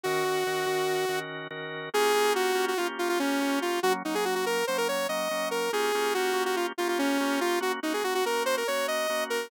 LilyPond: <<
  \new Staff \with { instrumentName = "Lead 2 (sawtooth)" } { \time 9/8 \key bes \minor \tempo 4. = 95 ges'2. r4. | aes'4 ges'8. ges'16 f'16 r16 f'16 f'16 des'4 f'8 | ges'16 r16 ees'16 aes'16 ges'16 ges'16 bes'8 c''16 bes'16 des''8 ees''4 bes'8 | aes'4 ges'8. ges'16 f'16 r16 f'16 f'16 des'4 f'8 |
ges'16 r16 ees'16 aes'16 ges'16 ges'16 bes'8 c''16 bes'16 des''8 ees''4 bes'8 | }
  \new Staff \with { instrumentName = "Drawbar Organ" } { \time 9/8 \key bes \minor <ees des' ges' bes'>8 <ees des' ges' bes'>8 <ees des' ges' bes'>8 <ees des' ges' bes'>4 <ees des' ges' bes'>4 <ees des' ges' bes'>4 | <bes des' f' g'>8 <bes des' f' g'>4 <bes des' f' g'>8 <bes des' f' g'>4 <bes des' f' g'>8 <bes des' f' g'>4 | <ges bes des'>8 <ges bes des'>4 <ges bes des'>8 <ges bes des'>4 <ges bes des'>8 <ges bes des'>4 | <bes des' f' g'>8 <bes des' f' g'>8 <bes des' f' g'>8 <bes des' f' g'>4 <bes des' f' g'>4 <bes des' f' g'>4 |
<bes des' ges'>8 <bes des' ges'>8 <bes des' ges'>8 <bes des' ges'>4 <bes des' ges'>4 <bes des' ges'>4 | }
>>